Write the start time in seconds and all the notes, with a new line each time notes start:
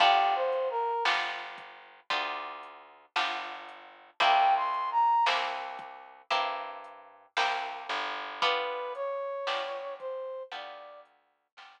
0.00 G1 B3 D4 F4 G4, kick, crash
0.35 C5
0.52 closed hi-hat
0.70 A#4
1.05 G1 B3 D4 F4 G4, snare
1.58 kick, closed hi-hat
2.10 D2 B3 D4 F4 G4, kick, closed hi-hat
2.63 closed hi-hat
3.16 G1 B3 D4 F4 G4, snare
3.69 closed hi-hat
4.20 C2 A#3 C4 E4 G4 G5, kick, closed hi-hat
4.56 C6
4.74 closed hi-hat
4.91 A#5
5.26 C2 A#3 C4 E4 G4, snare
5.79 kick, closed hi-hat
6.30 G2 A#3 C4 E4 G4, kick, closed hi-hat
6.84 closed hi-hat
7.37 C2 A#3 C4 E4 G4, snare
7.89 G1, closed hi-hat
8.42 B3 D4 F4 G4 B4, kick, closed hi-hat
8.95 C#5, closed hi-hat
9.47 G1 B3 D4 F4 G4, snare
9.99 C5, kick, closed hi-hat
10.52 D2 B3 D4 F4 G4 D5, kick, closed hi-hat
11.05 closed hi-hat
11.57 G1 B3 D4 F4 G4, snare